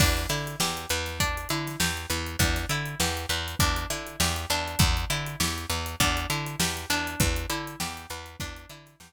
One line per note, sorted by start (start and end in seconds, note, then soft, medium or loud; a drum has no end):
0.00 0.26 E2 medium
0.00 0.27 D4 medium
0.00 kick medium
0.00 crash medium
0.17 snare soft
0.17 closed hi-hat medium
0.29 0.56 D3 medium
0.29 0.57 E4 medium
0.29 closed hi-hat medium
0.47 closed hi-hat medium
0.60 0.86 E2 medium
0.60 0.88 G4 medium
0.60 snare medium
0.77 closed hi-hat medium
0.90 1.46 E2 medium
0.90 1.18 B4 medium
0.90 closed hi-hat medium
1.06 snare soft
1.06 closed hi-hat medium
1.20 1.48 D4 medium
1.20 kick medium
1.20 closed hi-hat medium
1.37 closed hi-hat medium
1.49 1.76 D3 medium
1.49 1.78 E4 medium
1.49 closed hi-hat medium
1.67 snare soft
1.67 closed hi-hat medium
1.80 2.06 E2 medium
1.80 2.07 G4 medium
1.80 snare medium
1.97 closed hi-hat soft
2.10 2.36 E2 medium
2.10 2.37 B4 medium
2.10 closed hi-hat medium
2.27 closed hi-hat medium
2.39 2.66 E2 medium
2.39 2.67 D4 medium
2.39 kick medium
2.39 closed hi-hat medium
2.56 snare soft
2.56 closed hi-hat medium
2.69 2.95 D3 medium
2.69 2.98 E4 medium
2.69 closed hi-hat medium
2.85 closed hi-hat medium
3.00 3.26 E2 medium
3.00 3.27 G4 medium
3.00 snare medium
3.17 closed hi-hat medium
3.29 3.55 E2 medium
3.29 3.57 B4 medium
3.29 closed hi-hat medium
3.48 closed hi-hat medium
3.59 3.86 E2 medium
3.59 3.87 D4 medium
3.59 kick medium
3.59 closed hi-hat medium
3.76 closed hi-hat medium
3.90 4.16 D3 medium
3.90 4.17 E4 medium
3.90 closed hi-hat medium
4.07 closed hi-hat medium
4.20 4.46 E2 medium
4.20 4.48 G4 medium
4.20 snare medium
4.36 closed hi-hat medium
4.50 4.76 E2 medium
4.50 5.08 D4 medium
4.50 closed hi-hat medium
4.68 closed hi-hat medium
4.79 5.05 E2 loud
4.79 kick loud
4.79 closed hi-hat medium
4.97 closed hi-hat medium
5.10 5.36 D3 medium
5.10 5.38 E4 medium
5.10 closed hi-hat medium
5.26 closed hi-hat medium
5.40 5.66 E2 medium
5.40 5.67 G4 medium
5.40 snare medium
5.58 closed hi-hat medium
5.70 5.96 E2 medium
5.70 5.97 B4 medium
5.70 snare soft
5.70 closed hi-hat medium
5.86 closed hi-hat medium
6.00 6.26 E2 medium
6.00 6.27 D4 medium
6.00 kick medium
6.00 closed hi-hat medium
6.17 closed hi-hat medium
6.30 6.56 D3 medium
6.30 6.57 E4 medium
6.30 closed hi-hat medium
6.46 closed hi-hat medium
6.59 6.86 E2 medium
6.59 6.87 G4 medium
6.59 snare loud
6.77 snare soft
6.77 closed hi-hat medium
6.90 7.16 E2 medium
6.90 7.48 D4 medium
6.90 closed hi-hat medium
7.07 closed hi-hat medium
7.20 7.46 E2 medium
7.20 kick medium
7.20 closed hi-hat medium
7.36 closed hi-hat medium
7.50 7.76 D3 medium
7.50 7.77 E4 medium
7.50 closed hi-hat medium
7.67 closed hi-hat medium
7.80 8.06 E2 medium
7.80 8.07 G4 medium
7.80 snare medium
7.97 closed hi-hat medium
8.10 8.36 E2 medium
8.10 8.38 B4 medium
8.10 snare soft
8.10 closed hi-hat medium
8.26 closed hi-hat medium
8.40 8.66 E2 medium
8.40 8.68 D4 medium
8.40 kick medium
8.40 closed hi-hat medium
8.56 closed hi-hat medium
8.69 8.96 D3 medium
8.69 8.98 E4 medium
8.69 closed hi-hat medium
8.86 snare soft
8.86 closed hi-hat medium
9.00 9.12 E2 medium
9.00 9.12 G4 medium
9.00 snare loud